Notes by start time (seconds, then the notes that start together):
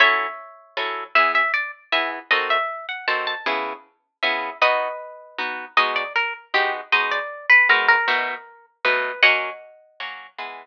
0.00 F#3 C#4 E4 A4 C#5 E5
0.77 F#3 C#4 E4 A4
1.15 E3 B3 G#4 E5
1.35 E5
1.54 D5
1.92 E3 B3 G#4 E5
2.31 D#3 C4 F#4 A4 D#5
2.50 E5
2.89 F#5
3.08 D#3 C4 F#4 A4 A5
3.27 A5
3.46 C#3 B3 E4 G#4
4.23 C#3 B3 E4 G#4 E5
4.62 B3 D#4 F#4 B4 D#5
5.38 B3 D#4 F#4
5.77 G#3 B3 D#4 F#4 D#5
5.96 D5
6.16 A#4
6.54 G#3 B3 D#4 F#4 G4
6.92 G#3 B3 D#4 F#4 D#5
7.11 D5
7.50 B4
7.69 G#3 B3 D#4 F#4 A#4
7.88 A#4
8.08 B2 A3 D#4 F#4
8.85 B2 A3 D#4 F#4 B4
9.23 F#3 A#3 C#4 D#5 F#5
10.00 F#3 A#3 C#4
10.38 E3 G#3 B3